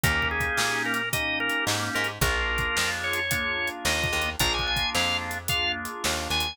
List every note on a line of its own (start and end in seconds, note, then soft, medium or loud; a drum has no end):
0.04 0.50 D#2 medium
0.04 1.02 A#3 loud
0.04 1.02 C#4 loud
0.04 1.02 D#4 loud
0.04 1.02 G4 loud
0.04 0.28 A#4 loud
0.04 kick loud
0.04 closed hi-hat loud
0.22 kick medium
0.31 0.83 G#4 medium
0.40 kick loud
0.40 closed hi-hat medium
0.57 1.50 A#2 medium
0.57 snare loud
0.86 1.09 A#4 medium
0.94 closed hi-hat medium
1.13 2.11 A#3 medium
1.13 2.11 C#4 medium
1.13 2.11 D#4 medium
1.13 2.11 G4 medium
1.13 1.39 D#5 medium
1.13 kick loud
1.13 closed hi-hat loud
1.40 1.65 A#4 medium
1.49 closed hi-hat medium
1.67 1.90 G#2 medium
1.67 snare loud
1.95 2.19 G#2 medium
1.95 2.08 A#4 medium
2.04 closed hi-hat medium
2.21 2.68 A#1 loud
2.21 3.20 A#3 loud
2.21 3.20 D4 loud
2.21 3.20 F4 loud
2.21 3.20 G#4 loud
2.21 2.91 A#4 medium
2.21 kick loud
2.21 closed hi-hat loud
2.58 kick loud
2.58 closed hi-hat medium
2.77 3.70 F2 medium
2.77 snare loud
3.04 3.69 C#5 medium
3.13 closed hi-hat loud
3.31 4.29 A#3 medium
3.31 4.29 D4 medium
3.31 4.29 F4 loud
3.31 4.29 G#4 medium
3.31 kick loud
3.31 closed hi-hat loud
3.68 closed hi-hat medium
3.85 4.08 D#2 medium
3.85 4.30 D#5 medium
3.85 snare loud
4.04 kick loud
4.13 4.36 D#2 medium
4.22 closed hi-hat medium
4.39 4.86 A#1 medium
4.39 5.38 A#3 loud
4.39 5.38 D4 loud
4.39 5.38 F4 loud
4.39 5.38 G#4 loud
4.39 4.53 A#5 loud
4.39 kick loud
4.39 closed hi-hat loud
4.54 4.67 G#5 medium
4.59 kick medium
4.67 4.90 G#5 medium
4.76 kick loud
4.76 closed hi-hat medium
4.95 5.87 F2 medium
4.95 5.17 F5 medium
4.95 snare loud
5.31 closed hi-hat medium
5.48 6.47 A#3 medium
5.48 6.47 D4 medium
5.48 6.47 F4 medium
5.48 6.47 G#4 medium
5.48 5.72 F5 medium
5.48 kick loud
5.48 closed hi-hat loud
5.85 closed hi-hat medium
6.04 6.28 D#2 medium
6.04 snare loud
6.30 6.53 D#2 medium
6.30 6.57 G#5 medium
6.40 closed hi-hat loud